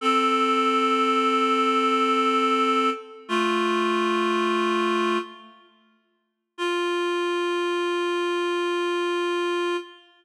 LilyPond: \new Staff { \time 4/4 \key f \major \tempo 4 = 73 <c' a'>1 | <a f'>2~ <a f'>8 r4. | f'1 | }